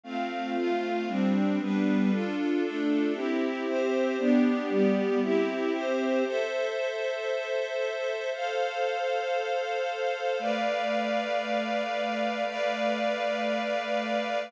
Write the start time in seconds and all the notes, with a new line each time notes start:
0.03 A3 C4 F4 F5
0.56 A3 F4 F5
1.07 G3 C4 D4
1.59 G3 B3 D4 B4
2.11 D4 F4 A4
2.63 A3 D4 A4
3.14 C4 E4 G4 E5
3.66 C4 G4 C5
4.18 B3 D4 G4 D5
4.69 G3 B3 G4
5.21 C4 E4 G4 E5
5.73 C4 G4 C5
6.25 A4 C5 E5
8.33 A4 C5 F5
10.39 A3 B4 D5 F5
12.46 A3 B4 D5 F5